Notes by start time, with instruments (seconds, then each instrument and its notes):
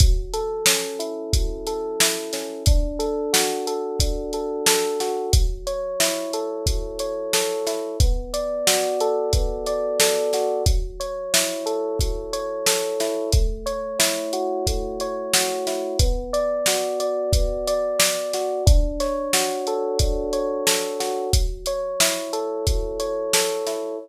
0.00 electric piano 1 F#3, kick, closed hi-hat
0.33 electric piano 1 A4, closed hi-hat
0.66 electric piano 1 C#4, snare
0.99 electric piano 1 E4, closed hi-hat
1.33 electric piano 1 F#3, kick, closed hi-hat
1.67 electric piano 1 A4, closed hi-hat
2.00 electric piano 1 E4, snare
2.33 electric piano 1 C#4, snare, closed hi-hat
2.66 electric piano 1 D4, kick, closed hi-hat
2.99 electric piano 1 A4, closed hi-hat
3.33 electric piano 1 F#4, snare
3.67 electric piano 1 A4, closed hi-hat
4.00 electric piano 1 D4, kick, closed hi-hat
4.33 electric piano 1 A4, closed hi-hat
4.66 electric piano 1 A4, snare
5.00 electric piano 1 F#4, snare, closed hi-hat
5.33 electric piano 1 F#3, kick, closed hi-hat
5.67 electric piano 1 C#5, closed hi-hat
6.00 electric piano 1 E4, snare
6.33 electric piano 1 A4, closed hi-hat
6.66 electric piano 1 F#3, kick, closed hi-hat
6.99 electric piano 1 C#5, closed hi-hat
7.33 electric piano 1 A4, snare
7.67 electric piano 1 E4, snare, closed hi-hat
8.00 electric piano 1 B3, kick, closed hi-hat
8.33 electric piano 1 D5, closed hi-hat
8.67 electric piano 1 F#4, snare
9.00 electric piano 1 A4, closed hi-hat
9.33 electric piano 1 B3, kick, closed hi-hat
9.66 electric piano 1 D5, closed hi-hat
10.00 electric piano 1 A4, snare
10.33 electric piano 1 F#4, snare, closed hi-hat
10.66 electric piano 1 F#3, kick, closed hi-hat
11.00 electric piano 1 C#5, closed hi-hat
11.33 electric piano 1 E4, snare
11.66 electric piano 1 A4, closed hi-hat
11.99 electric piano 1 F#3, kick, closed hi-hat
12.33 electric piano 1 C#5, closed hi-hat
12.66 electric piano 1 A4, snare
13.00 electric piano 1 E4, snare, closed hi-hat
13.33 electric piano 1 A3, kick, closed hi-hat
13.66 electric piano 1 C#5, closed hi-hat
13.99 electric piano 1 E4, snare
14.33 electric piano 1 F#4, closed hi-hat
14.67 electric piano 1 A3, kick, closed hi-hat
15.00 electric piano 1 C#5, closed hi-hat
15.33 electric piano 1 F#4, snare
15.67 electric piano 1 E4, snare, closed hi-hat
15.99 electric piano 1 B3, kick, closed hi-hat
16.33 electric piano 1 D5, closed hi-hat
16.66 electric piano 1 F#4, snare
17.00 electric piano 1 D5, closed hi-hat
17.33 electric piano 1 B3, kick, closed hi-hat
17.67 electric piano 1 D5, closed hi-hat
17.99 electric piano 1 D5, snare
18.33 electric piano 1 F#4, snare, closed hi-hat
18.66 electric piano 1 D4, kick, closed hi-hat
19.00 electric piano 1 C#5, snare, closed hi-hat
19.33 electric piano 1 F#4, snare
19.67 electric piano 1 A4, closed hi-hat
19.99 electric piano 1 D4, kick, closed hi-hat
20.33 electric piano 1 C#5, closed hi-hat
20.67 electric piano 1 A4, snare
21.00 electric piano 1 F#4, snare, closed hi-hat
21.33 electric piano 1 F#3, kick, closed hi-hat
21.66 electric piano 1 C#5, closed hi-hat
22.00 electric piano 1 E4, snare
22.33 electric piano 1 A4, closed hi-hat
22.67 electric piano 1 F#3, kick, closed hi-hat
23.00 electric piano 1 C#5, closed hi-hat
23.33 electric piano 1 A4, snare
23.67 electric piano 1 E4, snare, closed hi-hat